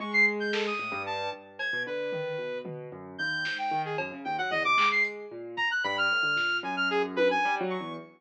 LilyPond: <<
  \new Staff \with { instrumentName = "Acoustic Grand Piano" } { \clef bass \time 5/8 \tempo 4 = 113 gis4. a,16 g,8. | g,8. b,16 d8 dis8 b,8 | b,8 fis,8 dis,8 gis,8 dis8 | fis,16 cis16 dis,16 fis16 e,16 c16 gis4 |
ais,8 r8 g,8 a,16 d16 ais,8 | fis,4. \tuplet 3/2 { g8 fis8 e,8 } | }
  \new Staff \with { instrumentName = "Lead 2 (sawtooth)" } { \time 5/8 cis'''16 c''''16 r16 g'''16 a'16 dis'''8. a''8 | r8 gis'''8 b'4. | r4 g'''8. g''8 gis'16 | r8 g''16 fis''16 dis''16 d'''8 c''''16 r8 |
r8 ais''16 fis'''16 b''16 f'''4~ f'''16 | gis''16 f'''16 gis'16 r16 b'16 gis''8 r16 cis'''8 | }
  \new DrumStaff \with { instrumentName = "Drums" } \drummode { \time 5/8 r4 sn8 r4 | r8 cb4 tomfh4 | tomfh4. sn4 | cb4 tomfh8 hc8 hh8 |
r8 bd4 r8 sn8 | r4 tommh8 cb4 | }
>>